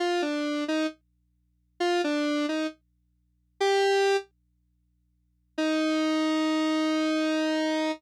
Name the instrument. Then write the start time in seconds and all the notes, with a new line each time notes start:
lead 1 (square)
0.00 F4
0.22 D4
0.68 D#4
1.80 F4
2.04 D4
2.49 D#4
3.60 G4
5.58 D#4